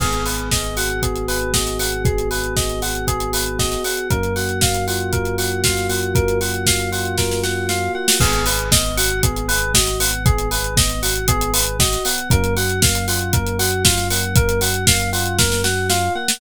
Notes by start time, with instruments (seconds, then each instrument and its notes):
0.00 synth bass 1 G#1, electric piano 1 B3, electric piano 2 G#4, kick, crash
0.13 closed hi-hat
0.25 electric piano 1 G#4, electric piano 2 B4, open hi-hat
0.38 closed hi-hat
0.51 electric piano 1 B3, electric piano 2 D#5, kick, snare
0.64 closed hi-hat
0.77 electric piano 1 F#4, electric piano 2 F#5, open hi-hat
0.90 closed hi-hat
1.02 electric piano 1 B3, electric piano 2 G#4, kick, closed hi-hat
1.15 closed hi-hat
1.28 electric piano 1 G#4, electric piano 2 B4, open hi-hat
1.41 closed hi-hat
1.54 electric piano 1 F#4, electric piano 2 D#5, kick, snare
1.66 snare, closed hi-hat
1.79 electric piano 1 B3, electric piano 2 F#5, open hi-hat
1.92 closed hi-hat
2.05 electric piano 1 B3, electric piano 2 G#4, kick, closed hi-hat
2.18 closed hi-hat
2.31 electric piano 1 G#4, electric piano 2 B4, open hi-hat
2.44 closed hi-hat
2.56 electric piano 1 B3, electric piano 2 D#5, kick, snare
2.69 closed hi-hat
2.82 electric piano 1 F#4, electric piano 2 F#5, open hi-hat
2.95 closed hi-hat
3.07 electric piano 1 B3, electric piano 2 G#4, kick, closed hi-hat
3.20 closed hi-hat
3.33 electric piano 1 G#4, electric piano 2 B4, open hi-hat
3.46 closed hi-hat
3.59 electric piano 1 F#4, electric piano 2 D#5, kick, snare
3.71 snare, closed hi-hat
3.84 electric piano 1 B3, electric piano 2 F#5, open hi-hat
3.97 closed hi-hat
4.10 synth bass 1 F#2, electric piano 1 A#3, electric piano 2 A#4, kick, closed hi-hat
4.23 closed hi-hat
4.36 electric piano 1 F#4, electric piano 2 F#5, open hi-hat
4.49 closed hi-hat
4.61 electric piano 1 A#3, electric piano 2 F5, kick, snare
4.74 closed hi-hat
4.88 electric piano 1 F4, electric piano 2 F#5, open hi-hat
5.00 closed hi-hat
5.13 electric piano 1 A#3, electric piano 2 A#4, kick, closed hi-hat
5.25 closed hi-hat
5.38 electric piano 1 F#4, electric piano 2 F#5, open hi-hat
5.52 closed hi-hat
5.64 electric piano 1 F4, electric piano 2 F5, kick, snare
5.77 snare, closed hi-hat
5.89 electric piano 1 A#3, electric piano 2 F#5, open hi-hat
6.03 closed hi-hat
6.15 electric piano 1 A#3, electric piano 2 A#4, kick, closed hi-hat
6.28 closed hi-hat
6.41 electric piano 1 F#4, electric piano 2 F#5, open hi-hat
6.54 closed hi-hat
6.66 electric piano 1 A#3, electric piano 2 F5, kick, snare
6.79 closed hi-hat
6.92 electric piano 1 F4, electric piano 2 F#5, open hi-hat
7.05 closed hi-hat
7.18 electric piano 1 A#3, electric piano 2 A#4, kick, snare
7.31 snare
7.43 electric piano 1 F#4, electric piano 2 F#5, snare
7.69 electric piano 1 F4, electric piano 2 F5, snare
7.95 electric piano 1 A#3, electric piano 2 F#5
8.08 snare
8.20 synth bass 1 G#1, electric piano 1 B3, electric piano 2 G#4, kick, crash
8.33 closed hi-hat
8.46 electric piano 1 G#4, electric piano 2 B4, open hi-hat
8.59 closed hi-hat
8.72 electric piano 1 B3, electric piano 2 D#5, kick, snare
8.85 closed hi-hat
8.97 electric piano 1 F#4, electric piano 2 F#5, open hi-hat
9.10 closed hi-hat
9.23 electric piano 1 B3, electric piano 2 G#4, kick, closed hi-hat
9.36 closed hi-hat
9.48 electric piano 1 G#4, electric piano 2 B4, open hi-hat
9.62 closed hi-hat
9.74 electric piano 1 F#4, electric piano 2 D#5, kick, snare
9.87 snare, closed hi-hat
10.00 electric piano 1 B3, electric piano 2 F#5, open hi-hat
10.13 closed hi-hat
10.25 electric piano 1 B3, electric piano 2 G#4, kick, closed hi-hat
10.38 closed hi-hat
10.51 electric piano 1 G#4, electric piano 2 B4, open hi-hat
10.64 closed hi-hat
10.77 electric piano 1 B3, electric piano 2 D#5, kick, snare
10.89 closed hi-hat
11.02 electric piano 1 F#4, electric piano 2 F#5, open hi-hat
11.15 closed hi-hat
11.28 electric piano 1 B3, electric piano 2 G#4, kick, closed hi-hat
11.41 closed hi-hat
11.54 electric piano 1 G#4, electric piano 2 B4, open hi-hat
11.67 closed hi-hat
11.79 electric piano 1 F#4, electric piano 2 D#5, kick, snare
11.92 snare, closed hi-hat
12.05 electric piano 1 B3, electric piano 2 F#5, open hi-hat
12.18 closed hi-hat
12.30 synth bass 1 F#2, electric piano 1 A#3, electric piano 2 A#4, kick, closed hi-hat
12.44 closed hi-hat
12.57 electric piano 1 F#4, electric piano 2 F#5, open hi-hat
12.69 closed hi-hat
12.82 electric piano 1 A#3, electric piano 2 F5, kick, snare
12.95 closed hi-hat
13.08 electric piano 1 F4, electric piano 2 F#5, open hi-hat
13.21 closed hi-hat
13.33 electric piano 1 A#3, electric piano 2 A#4, kick, closed hi-hat
13.46 closed hi-hat
13.59 electric piano 1 F#4, electric piano 2 F#5, open hi-hat
13.72 closed hi-hat
13.84 electric piano 1 F4, electric piano 2 F5, kick, snare
13.97 snare, closed hi-hat
14.10 electric piano 1 A#3, electric piano 2 F#5, open hi-hat
14.23 closed hi-hat
14.36 electric piano 1 A#3, electric piano 2 A#4, kick, closed hi-hat
14.49 closed hi-hat
14.61 electric piano 1 F#4, electric piano 2 F#5, open hi-hat
14.74 closed hi-hat
14.87 electric piano 1 A#3, electric piano 2 F5, kick, snare
15.00 closed hi-hat
15.13 electric piano 1 F4, electric piano 2 F#5, open hi-hat
15.26 closed hi-hat
15.38 electric piano 1 A#3, electric piano 2 A#4, kick, snare
15.52 snare
15.64 electric piano 1 F#4, electric piano 2 F#5, snare
15.90 electric piano 1 F4, electric piano 2 F5, snare
16.15 electric piano 1 A#3, electric piano 2 F#5
16.28 snare